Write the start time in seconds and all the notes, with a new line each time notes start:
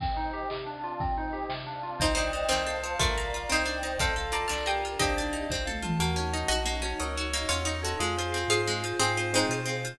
0.00 C4 C5 D#5 G5, kick, crash
0.17 D#4, closed hi-hat
0.33 G4, closed hi-hat
0.50 C3 C4 D5 F5 A5, clap
0.66 D4, closed hi-hat
0.84 F4, closed hi-hat
1.00 C4 C5 D#5 G5, kick, closed hi-hat
1.16 D#4, closed hi-hat
1.33 G4, closed hi-hat
1.49 C3 C4 D5 F5 A5, snare
1.67 D4, closed hi-hat
1.83 F4, closed hi-hat
2.00 C2 C4 D#4 C5 D5 D#5 G5, kick, closed hi-hat
2.08 closed hi-hat
2.15 D4 D#4 C5 D5 D#5, closed hi-hat
2.25 closed hi-hat
2.33 D#4 C5, closed hi-hat
2.42 closed hi-hat
2.49 C2 D#3 C4 C5 F5 A5, clap
2.58 closed hi-hat
2.66 A4 F5, closed hi-hat
2.75 closed hi-hat
2.83 F4 C5 A5, closed hi-hat
2.92 closed hi-hat
2.99 C2 A3 D4 F4 A#4 D5 F5 A#5, kick, closed hi-hat
3.08 closed hi-hat
3.17 A#4 F5, closed hi-hat
3.25 closed hi-hat
3.33 F4 A#5, closed hi-hat
3.42 closed hi-hat
3.49 C2 C4 D#4 C5 D5 D#5 G5, clap
3.58 closed hi-hat
3.65 D4 D5, closed hi-hat
3.75 closed hi-hat
3.83 D#4 D#5, closed hi-hat
3.92 closed hi-hat
3.99 C2 C4 F4 A4 C5 F5, kick, closed hi-hat
4.08 closed hi-hat
4.16 A4 F5, closed hi-hat
4.25 closed hi-hat
4.32 F4 D5 A5 A#5, closed hi-hat
4.42 closed hi-hat
4.48 C2 D4 F4 A#4 D5 A5 F6, snare
4.58 closed hi-hat
4.66 G4 A#4 F5 G5 D#6, closed hi-hat
4.75 closed hi-hat
4.84 F4 A#5, closed hi-hat
4.92 closed hi-hat
4.99 C2 C4 D4 D#4 G4 C5 D#5, kick, closed hi-hat
5.08 closed hi-hat
5.16 D4 D5, closed hi-hat
5.25 closed hi-hat
5.33 D#4 D#5, closed hi-hat
5.41 closed hi-hat
5.50 C2 C4 F4 A4 C5, kick, snare
5.65 A4 F5, high tom
5.82 F4 A5, mid tom
5.99 D#2 A#3 C#4 D#4 F#4 A#4
6.16 C#4 C#5
6.33 D#4 D#5
6.48 A#1 F#4 D#5 F#5
6.65 A#3 D#5
6.82 C#4 F#4 C#5
7.00 C#2 D#4 A#4 C#5
7.16 F#4 C#5
7.33 A#3 D#5
7.49 E2 C#4 F4 C#5 F#5
7.65 D#4 D#5
7.83 F#4 A4 C#5
7.99 F2 G#3 C4 F4 G#4
8.18 F4 C5
8.32 C4 F5
8.48 G#2 F4 G#4 C5 F5
8.67 G#3 G#4
8.83 F4 C5
9.00 G#2 C4 F4 G#4 C5 F5
9.17 F4 C5
9.33 G#3 C4 D#4 G#4 C5
9.49 B2 F4 C5
9.65 C4 F5
9.84 F4 C5